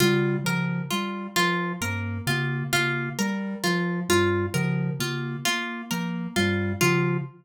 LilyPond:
<<
  \new Staff \with { instrumentName = "Glockenspiel" } { \clef bass \time 4/4 \tempo 4 = 66 des8 des8 r8 f8 g,8 des8 des8 r8 | f8 g,8 des8 des8 r8 f8 g,8 des8 | }
  \new Staff \with { instrumentName = "Ocarina" } { \time 4/4 g8 f8 g8 f8 bes8 bes8 bes8 g8 | f8 g8 f8 bes8 bes8 bes8 g8 f8 | }
  \new Staff \with { instrumentName = "Orchestral Harp" } { \time 4/4 f'8 bes'8 f'8 f'8 bes'8 f'8 f'8 bes'8 | f'8 f'8 bes'8 f'8 f'8 bes'8 f'8 f'8 | }
>>